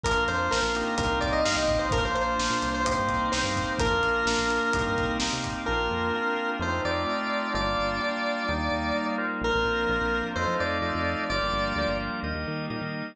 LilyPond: <<
  \new Staff \with { instrumentName = "Lead 1 (square)" } { \time 4/4 \key bes \major \tempo 4 = 128 bes'8 c''8 bes'4 bes'8 d''16 ees''16 f''16 ees''8 c''16 | bes'16 c''16 c''4~ c''16 c''16 c''4 c''4 | bes'2. r4 | bes'2 c''8 d''4. |
d''1 | bes'2 c''8 d''4. | d''4. r2 r8 | }
  \new Staff \with { instrumentName = "Drawbar Organ" } { \time 4/4 \key bes \major <bes d' f'>4 <bes d' f'>8 <bes c' ees' g'>4. <bes c' ees' g'>4 | <bes d' f'>4 <bes d' f'>4 <bes c' ees' g'>4 <bes c' ees' g'>4 | <bes d' f'>4 <bes d' f'>4 <bes c' ees' g'>4 <bes c' ees' g'>4 | <bes c' d' f'>4 <bes c' d' f'>4 <a c' ees' f'>4 <a c' ees' f'>4 |
<g bes d' f'>4 <g bes d' f'>4 <g bes ees'>4 <g bes ees'>8 <f' bes' c'' d''>8~ | <f' bes' c'' d''>4 <f' bes' c'' d''>4 <f' a' c'' ees''>4 <f' a' c'' ees''>4 | <f' g' bes' d''>4 <f' g' bes' d''>4 <g' bes' ees''>4 <g' bes' ees''>4 | }
  \new Staff \with { instrumentName = "Synth Bass 1" } { \clef bass \time 4/4 \key bes \major bes,,16 bes,,16 f,8 bes,,16 bes,,8. c,16 c,16 c,8 g,16 c,16 bes,,8~ | bes,,16 bes,,16 bes,,8 bes,,16 bes,16 c,8. g,16 c,8 c,16 g,8. | bes,,16 f,16 bes,,8 bes,,16 bes,,8. c,16 g,16 c,8 c,16 c8. | bes,,8 f,4. f,8 f,4. |
g,,8 g,,4. ees,8 ees,4. | bes,,16 bes,,16 bes,,8 bes,,16 bes,,8. f,16 f16 f,8 f,16 f,8. | g,,16 g,,16 g,,8 d,16 g,,8. ees,16 ees,16 ees8 bes,16 ees8. | }
  \new Staff \with { instrumentName = "Pad 5 (bowed)" } { \time 4/4 \key bes \major <bes d' f'>2 <bes c' ees' g'>2 | <bes d' f'>2 <bes c' ees' g'>2 | <bes d' f'>2 <bes c' ees' g'>2 | <bes c' d' f'>2 <a c' ees' f'>2 |
<g bes d' f'>2 <g bes ees'>2 | <f bes c' d'>2 <f a c' ees'>2 | <f g bes d'>2 <g bes ees'>2 | }
  \new DrumStaff \with { instrumentName = "Drums" } \drummode { \time 4/4 <hh bd>8 hh8 sn8 hh8 <hh bd>8 <hh bd>8 sn8 <hh bd>8 | <hh bd>8 hh8 sn8 hh8 <hh bd>8 <hh bd>8 sn8 <hh bd>8 | <hh bd>8 hh8 sn8 hh8 <hh bd>8 <hh bd>8 sn8 <hh bd>8 | r4 r4 r4 r4 |
r4 r4 r4 r4 | r4 r4 r4 r4 | r4 r4 r4 r4 | }
>>